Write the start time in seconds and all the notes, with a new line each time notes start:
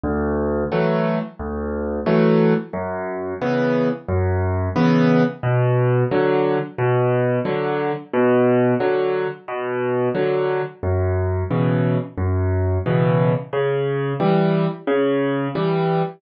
0.04 D2
0.72 E3 F#3 A3
1.39 D2
2.06 E3 F#3 A3
2.73 F#2
3.41 C#3 E3 B3
4.09 F#2
4.76 C#3 E3 B3
5.43 B2
6.11 D3 F#3
6.78 B2
7.45 D3 F#3
8.13 B2
8.80 D3 F#3
9.48 B2
10.15 D3 F#3
10.83 F#2
11.51 B2 C#3 E3
12.18 F#2
12.86 B2 C#3 E3
13.53 C#3
14.20 E3 G3
14.87 C#3
15.55 E3 G3